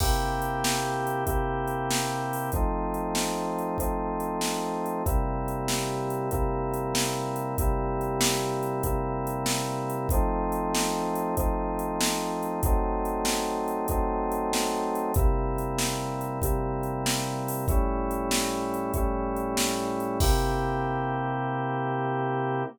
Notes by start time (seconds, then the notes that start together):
0.00 C3 A#3 E4 G4, kick, crash
0.42 closed hi-hat
0.64 snare
1.07 closed hi-hat
1.26 C3 A#3 E4 G4, kick, closed hi-hat
1.68 closed hi-hat
1.91 snare
2.33 open hi-hat
2.52 F3 A3 C4 D#4, kick, closed hi-hat
2.94 closed hi-hat
3.15 snare
3.59 closed hi-hat
3.78 F3 A3 C4 D#4, kick, closed hi-hat
4.20 closed hi-hat
4.41 snare
4.86 closed hi-hat
5.06 C3 G3 A#3 E4, kick, closed hi-hat
5.48 closed hi-hat
5.68 snare
6.10 closed hi-hat
6.31 C3 G3 A#3 E4, kick, closed hi-hat
6.74 closed hi-hat
6.95 snare
7.36 closed hi-hat
7.58 C3 G3 A#3 E4, kick, closed hi-hat
8.01 closed hi-hat
8.21 snare
8.63 closed hi-hat
8.83 C3 G3 A#3 E4, kick, closed hi-hat
9.27 closed hi-hat
9.46 snare
9.90 closed hi-hat
10.09 F3 A3 C4 D#4, kick, closed hi-hat
10.52 closed hi-hat
10.75 snare
11.15 closed hi-hat
11.37 F3 A3 C4 D#4, kick, closed hi-hat
11.79 closed hi-hat
12.01 snare
12.43 closed hi-hat
12.63 F#3 A3 C4 D#4, kick, closed hi-hat
13.05 closed hi-hat
13.25 snare
13.68 closed hi-hat
13.88 F#3 A3 C4 D#4, kick, closed hi-hat
14.32 closed hi-hat
14.53 snare
14.95 closed hi-hat
15.14 C3 G3 A#3 E4, kick, closed hi-hat
15.58 closed hi-hat
15.79 snare
16.21 closed hi-hat
16.42 C3 G3 A#3 E4, kick, closed hi-hat
16.83 closed hi-hat
17.06 snare
17.48 open hi-hat
17.68 A2 G3 C#4 E4, kick, closed hi-hat
18.11 closed hi-hat
18.31 snare
18.74 closed hi-hat
18.94 A2 G3 C#4 E4, kick, closed hi-hat
19.36 closed hi-hat
19.57 snare
20.00 closed hi-hat
20.20 C3 A#3 E4 G4, kick, crash